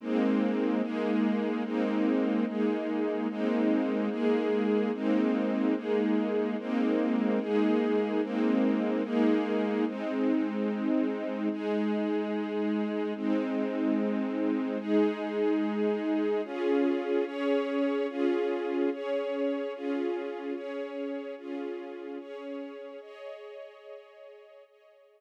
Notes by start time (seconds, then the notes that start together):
0.00 G#3 A#3 C4 D#4
0.82 G#3 A#3 D#4 G#4
1.64 G#3 A#3 C4 D#4
2.46 G#3 A#3 D#4 G#4
3.29 G#3 A#3 C4 D#4
4.09 G#3 A#3 D#4 G#4
4.93 G#3 A#3 C4 D#4
5.75 G#3 A#3 D#4 G#4
6.58 G#3 A#3 C4 D#4
7.40 G#3 A#3 D#4 G#4
8.22 G#3 A#3 C4 D#4
9.03 G#3 A#3 D#4 G#4
9.86 G#3 C4 D#4
11.51 G#3 D#4 G#4
13.15 G#3 C4 D#4
14.79 G#3 D#4 G#4
16.44 C#4 F4 G#4
17.25 C#4 G#4 C#5
18.08 C#4 F4 G#4
18.92 C#4 G#4 C#5
19.74 C#4 F4 G#4
20.54 C#4 G#4 C#5
21.37 C#4 F4 G#4
22.19 C#4 G#4 C#5
23.01 G#4 C#5 D#5
24.66 G#4 C#5 D#5